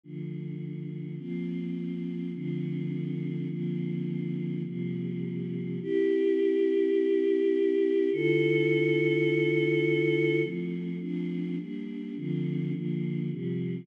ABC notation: X:1
M:6/8
L:1/8
Q:3/8=104
K:F
V:1 name="Choir Aahs"
[D,F,A,]6 | [F,B,C]6 | [D,F,A,C]6 | [D,F,B,C]6 |
[C,F,G,B,]6 | [K:C] [CEG]6- | [CEG]6 | [D,EFA]6- |
[D,EFA]6 | [K:F] [F,A,C]3 [F,A,CD]3 | [G,B,D]3 [D,F,A,C]3 | [D,F,B,]3 [C,F,G,]3 |]